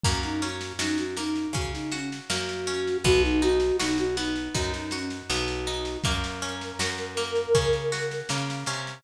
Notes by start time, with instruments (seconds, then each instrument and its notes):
0.03 electric bass (finger) F#2, orchestral harp A#3, flute F#4, kick, snare
0.23 flute D#4, snare
0.42 orchestral harp C#4, flute F#4, snare
0.61 snare
0.79 electric bass (finger) F#2, flute D#4, orchestral harp F#4, snare
0.98 flute F#4, snare
1.17 orchestral harp A#3, flute D#4, snare
1.35 snare
1.53 electric bass (finger) C#3, orchestral harp C#4, flute F#4, kick, snare
1.73 flute D#4, snare
1.92 flute C#4, orchestral harp F#4, snare
2.12 snare
2.30 electric bass (finger) F#2, orchestral harp A#3, flute F#4, snare
2.49 snare
2.67 orchestral harp C#4, snare
2.87 snare
3.04 electric bass (finger) B1, orchestral harp B3, flute F#4, kick, snare
3.23 flute D#4, snare
3.42 orchestral harp D#4, flute F#4, snare
3.60 snare
3.79 electric bass (finger) B1, flute D#4, orchestral harp F#4, snare
3.98 flute F#4, snare
4.17 orchestral harp B3, flute D#4, snare
4.36 snare
4.54 electric bass (finger) F#2, orchestral harp D#4, flute F#4, kick, snare
4.73 flute D#4, snare
4.91 flute C#4, orchestral harp F#4, snare
5.10 snare
5.30 electric bass (finger) B1, orchestral harp B3, flute F#4, snare
5.48 snare
5.67 orchestral harp D#4, snare
5.85 snare
6.04 electric bass (finger) F#2, orchestral harp A#3, flute A#4, kick, snare
6.24 snare
6.42 orchestral harp C#4, snare
6.61 snare
6.79 electric bass (finger) F#2, orchestral harp F#4, snare
6.98 snare
7.17 orchestral harp A#3, snare
7.35 snare
7.55 electric bass (finger) C#3, orchestral harp C#4, kick, snare
7.73 snare
7.92 orchestral harp F#4, snare
8.11 snare
8.29 electric bass (finger) C#3, orchestral harp A#3, snare
8.50 snare
8.66 electric bass (finger) C3, orchestral harp C#4, snare
8.87 snare